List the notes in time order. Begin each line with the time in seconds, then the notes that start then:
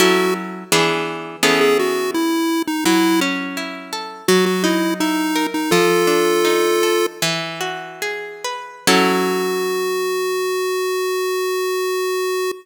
0.00 F#3 C#4 E4 F#4 A4
0.72 E3 B3 D4 G#4
1.43 E3 B3 C#4 G#4 A4
1.61 G#4
1.79 F#4
2.14 E4
2.67 D#4
2.85 F#3 E4
3.21 C#4
3.57 E4
3.93 A4
4.28 F#3 F#4
4.46 F#4
4.64 D#4 E4
5.00 D#4 E4
5.36 A#4
5.54 D#4
5.71 F3 F4 A4
6.07 D4
6.45 D#4
6.83 A4
7.22 E3
7.61 F#4
8.02 G#4
8.44 B4
8.87 F#3 C#4 E4 F#4 A4